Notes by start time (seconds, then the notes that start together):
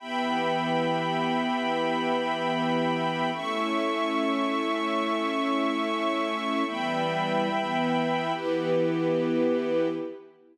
0.00 E3 B3 G4 E5 G5 B5
3.33 A3 C#4 E4 A4 E5 C#6
6.67 E3 G3 B3 E5 G5 B5
7.50 E3 B3 E4
8.33 E3 B3 E4 G4 B4